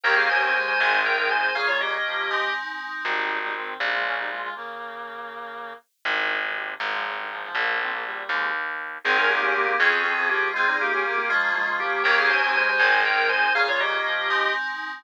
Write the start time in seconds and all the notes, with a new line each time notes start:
0.03 D#2 A#3 C#4 D#4 G4 A#4 G5
0.16 G#4 F5
0.30 C#4 C5 G#5
0.42 C4 C5 G#5
0.54 G#3 C5 G#5
0.68 C5 G#5
0.79 G#1 D#3 C4 D#4 G#4 C5 G#5
1.05 A#4 G5
1.17 D#3 A#4 G5
1.30 D#3 C5 G#5
1.55 A#2 C#3 A#3 C#4 F4 G#4 F5
1.68 F4 C#5
1.80 G4 D#5
2.05 F3
2.30 G#3 C4 D#4
3.05 G#1 G3 D#4
3.42 G3 D#4
3.55 D#3 C4
3.80 A#1 G3 D#4
3.92 G#3 F4
4.05 F3 C#4
4.17 G3 D#4
4.30 G#3 F4
4.42 G#3 F4
4.55 C#3 A#3
6.05 G#1 G2 D#3
6.42 G2 D#3
6.55 D#2 C3
6.80 G#1 G2 D#3
6.92 G#2 F3
7.05 F2 C#3
7.17 G2 D#3
7.30 G#2 F3
7.42 G#2 F3
7.55 A#1 C#3 A#3
7.80 D#3 C4
7.92 C#3 A#3
8.05 A#2 G3
8.29 D#2 C3 G#3
9.04 G#1 C4 D#4 G#4
9.18 C#4 A#4
9.29 A#3 D#4 G4
9.42 A#3 C#4 G4
9.55 A#3 G4
9.66 A#3 G4
9.79 F2 F3 C4 C#4 F4 G#4
10.04 C4 G#4
10.17 F3 C4 G#4
10.29 F3 A#3 G4
10.54 G#3 C4 F4 G#4
10.68 G3 D#4
10.80 A#3 D#4 G4
10.92 A#3 C#4 G4
11.05 A#3 G4
11.18 A#3 G4
11.29 F3 G#3 A#3 C#4 F4
11.55 G#3 F4
11.67 F3 G#3 F4
11.80 F3 A#3 G4
12.04 D#2 A#3 C#4 D#4 G4 A#4 G5
12.18 G#4 F5
12.30 C#4 C5 G#5
12.42 C4 C5 G#5
12.55 G#3 C5 G#5
12.69 C5 G#5
12.79 G#1 D#3 C4 D#4 G#4 C5 G#5
13.05 A#4 G5
13.17 D#3 A#4 G5
13.29 D#3 C5 G#5
13.55 A#2 C#3 A#3 C#4 F4 G#4 F5
13.68 F4 C#5
13.80 G4 D#5
14.05 F3
14.30 G#3 C4 D#4